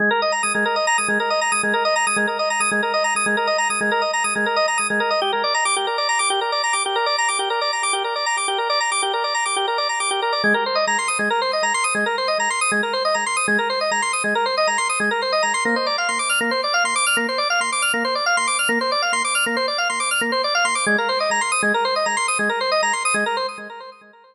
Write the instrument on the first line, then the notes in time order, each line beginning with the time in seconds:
drawbar organ
0.00 G#3
0.11 A#4
0.22 D#5
0.32 A#5
0.43 D#6
0.55 G#3
0.65 A#4
0.76 D#5
0.87 A#5
0.98 D#6
1.08 G#3
1.20 A#4
1.30 D#5
1.41 A#5
1.52 D#6
1.63 G#3
1.74 A#4
1.85 D#5
1.96 A#5
2.07 D#6
2.16 G#3
2.27 A#4
2.39 D#5
2.50 A#5
2.60 D#6
2.71 G#3
2.83 A#4
2.94 D#5
3.04 A#5
3.16 D#6
3.26 G#3
3.37 A#4
3.47 D#5
3.58 A#5
3.70 D#6
3.81 G#3
3.92 A#4
4.02 D#5
4.13 A#5
4.24 D#6
4.36 G#3
4.46 A#4
4.56 D#5
4.68 A#5
4.78 D#6
4.90 G#3
5.00 A#4
5.10 D#5
5.22 G4
5.33 A#4
5.44 D5
5.54 A#5
5.65 D6
5.76 G4
5.87 A#4
5.98 D5
6.09 A#5
6.19 D6
6.30 G4
6.41 A#4
6.52 D5
6.63 A#5
6.73 D6
6.86 G4
6.96 A#4
7.06 D5
7.18 A#5
7.28 D6
7.39 G4
7.50 A#4
7.61 D5
7.73 A#5
7.83 D6
7.93 G4
8.04 A#4
8.16 D5
8.26 A#5
8.37 D6
8.48 G4
8.58 A#4
8.70 D5
8.80 A#5
8.92 D6
9.03 G4
9.13 A#4
9.24 D5
9.34 A#5
9.45 D6
9.56 G4
9.68 A#4
9.78 D5
9.89 A#5
10.00 D6
10.11 G4
10.22 A#4
10.33 D5
10.44 G#3
10.54 A#4
10.66 C5
10.75 D#5
10.87 A#5
10.99 C6
11.08 D#6
11.19 G#3
11.30 A#4
11.42 C5
11.53 D#5
11.63 A#5
11.74 C6
11.84 D#6
11.95 G#3
12.06 A#4
12.18 C5
12.28 D#5
12.40 A#5
12.50 C6
12.61 D#6
12.72 G#3
12.83 A#4
12.93 C5
13.05 D#5
13.14 A#5
13.26 C6
13.37 D#6
13.48 G#3
13.59 A#4
13.70 C5
13.81 D#5
13.91 A#5
14.02 C6
14.13 D#6
14.24 G#3
14.35 A#4
14.46 C5
14.58 D#5
14.67 A#5
14.78 C6
14.89 D#6
15.00 G#3
15.11 A#4
15.22 C5
15.32 D#5
15.43 A#5
15.54 C6
15.65 A#3
15.76 C5
15.87 D5
15.98 F5
16.09 C6
16.19 D6
16.29 F6
16.41 A#3
16.51 C5
16.64 D5
16.74 F5
16.85 C6
16.96 D6
17.06 F6
17.17 A#3
17.29 C5
17.38 D5
17.50 F5
17.61 C6
17.72 D6
17.82 F6
17.94 A#3
18.05 C5
18.15 D5
18.26 F5
18.37 C6
18.47 D6
18.59 F6
18.69 A#3
18.81 C5
18.92 D5
19.02 F5
19.13 C6
19.25 D6
19.35 F6
19.46 A#3
19.57 C5
19.68 D5
19.78 F5
19.89 C6
20.00 D6
20.11 F6
20.21 A#3
20.32 C5
20.44 D5
20.55 F5
20.65 C6
20.75 D6
20.87 G#3
20.98 A#4
21.09 C5
21.20 D#5
21.31 A#5
21.41 C6
21.52 D#6
21.63 G#3
21.74 A#4
21.85 C5
21.96 D#5
22.06 A#5
22.17 C6
22.28 D#6
22.39 G#3
22.49 A#4
22.61 C5
22.72 D#5
22.83 A#5
22.93 C6
23.05 D#6
23.14 G#3
23.26 A#4
23.37 C5